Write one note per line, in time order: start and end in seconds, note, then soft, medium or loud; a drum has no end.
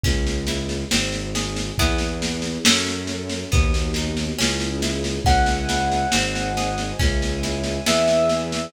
0.03 0.84 C#2 loud
0.03 0.43 C#4 medium
0.03 kick loud
0.03 snare medium
0.27 snare medium
0.47 0.87 E4 medium
0.47 snare medium
0.69 snare medium
0.91 1.71 G#1 loud
0.91 1.30 C4 medium
0.91 snare loud
1.12 snare medium
1.35 1.75 G#4 medium
1.35 snare loud
1.56 snare medium
1.78 2.58 E2 loud
1.78 2.64 B3 medium
1.78 2.57 B3 medium
1.78 2.64 E4 medium
1.78 2.57 E4 medium
1.78 2.64 G#4 medium
1.78 2.57 G#4 medium
1.78 kick loud
1.78 snare medium
1.98 snare medium
2.22 snare medium
2.42 snare medium
2.65 3.45 F#2 loud
2.65 3.51 C#4 medium
2.65 3.44 C#4 loud
2.65 3.51 F#4 medium
2.65 3.44 F#4 medium
2.65 3.51 A4 medium
2.65 3.44 A4 medium
2.65 snare loud
2.87 snare medium
3.07 snare medium
3.30 snare medium
3.52 4.32 D#2 loud
3.52 3.91 B3 medium
3.52 4.38 B3 medium
3.52 4.38 D#4 medium
3.52 4.38 F#4 medium
3.52 kick loud
3.52 snare medium
3.74 snare medium
3.94 4.35 D#4 medium
3.94 snare medium
4.17 snare medium
4.38 5.19 C#2 loud
4.38 4.78 C#4 medium
4.38 5.25 C#4 medium
4.38 5.25 E4 medium
4.38 5.25 G#4 medium
4.38 snare loud
4.60 snare medium
4.82 5.22 E4 medium
4.82 snare medium
5.04 snare medium
5.25 6.05 C#2 medium
5.25 5.65 C#4 medium
5.25 6.12 C#5 medium
5.25 6.12 E5 medium
5.25 6.93 F#5 medium
5.25 6.12 G#5 medium
5.25 kick loud
5.25 snare medium
5.46 snare medium
5.69 6.09 E4 medium
5.69 snare medium
5.91 snare medium
6.12 6.93 G#1 loud
6.12 6.52 C4 medium
6.12 6.99 C5 medium
6.12 6.99 D#5 medium
6.12 6.99 G#5 medium
6.12 snare loud
6.35 snare medium
6.57 6.96 G#4 medium
6.57 snare medium
6.78 snare medium
6.99 7.80 C#2 loud
6.99 7.38 C#4 medium
6.99 7.86 C#5 medium
6.99 7.86 E5 medium
6.99 7.86 G#5 medium
6.99 kick loud
6.99 snare medium
7.22 snare medium
7.43 7.83 E4 medium
7.43 snare medium
7.64 snare medium
7.86 8.67 E2 loud
7.86 8.65 B3 medium
7.86 8.65 E4 medium
7.86 8.65 G#4 medium
7.86 8.73 B4 medium
7.86 8.73 E5 medium
7.86 8.66 E5 medium
7.86 8.73 G#5 medium
7.86 snare loud
8.08 snare medium
8.29 snare medium
8.52 snare medium